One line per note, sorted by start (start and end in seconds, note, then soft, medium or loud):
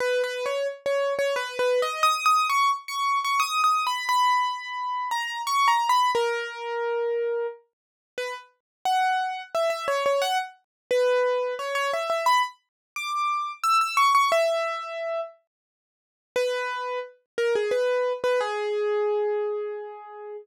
0.00 0.22 B4 loud
0.24 0.45 B4 loud
0.46 0.67 C#5 medium
0.86 1.14 C#5 medium
1.19 1.35 C#5 loud
1.36 1.58 B4 loud
1.59 1.81 B4 loud
1.82 2.04 D#5 loud
2.03 2.25 D#6 loud
2.26 2.47 D#6 loud
2.50 2.71 C#6 loud
2.88 3.19 C#6 medium
3.24 3.41 C#6 medium
3.40 3.61 D#6 loud
3.64 3.85 D#6 medium
3.87 4.08 B5 medium
4.09 5.09 B5 loud
5.11 5.42 A#5 medium
5.47 5.68 C#6 loud
5.68 5.89 A#5 medium
5.89 6.11 B5 loud
6.15 7.47 A#4 loud
8.18 8.34 B4 loud
8.85 9.42 F#5 loud
9.55 9.70 E5 medium
9.70 9.86 E5 medium
9.88 10.04 C#5 loud
10.06 10.22 C#5 medium
10.22 10.38 F#5 loud
10.91 11.55 B4 loud
11.59 11.74 C#5 medium
11.75 11.91 C#5 loud
11.93 12.09 E5 medium
12.10 12.26 E5 medium
12.26 12.42 B5 loud
12.96 13.52 D6 medium
13.63 13.80 E6 loud
13.81 13.97 E6 medium
13.97 14.13 C#6 loud
14.15 14.31 C#6 loud
14.32 15.21 E5 loud
16.36 16.99 B4 loud
17.38 17.54 A#4 medium
17.55 17.72 G#4 medium
17.71 18.13 B4 medium
18.24 18.40 B4 medium
18.40 20.37 G#4 loud